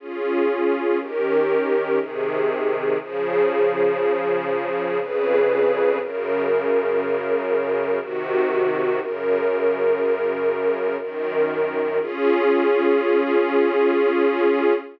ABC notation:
X:1
M:3/4
L:1/8
Q:1/4=60
K:Db
V:1 name="String Ensemble 1"
[DFA]2 [E,D=GB]2 [C,E,A]2 | [D,F,A]4 [F,,D,A_c]2 | [G,,D,B]4 [C,E,G]2 | [G,,D,B]4 [G,,E,B]2 |
[DFA]6 |]